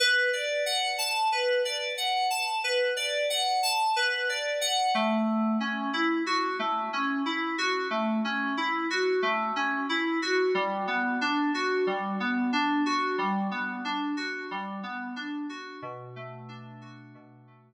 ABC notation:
X:1
M:4/4
L:1/8
Q:1/4=91
K:Bm
V:1 name="Electric Piano 2"
B d f a B d f a | B d f a B d f A,- | A, C E F A, C E F | A, C E F A, C E F |
G, B, D F G, B, D F | G, B, D F G, B, D F | B,, A, D F B,, A, z2 |]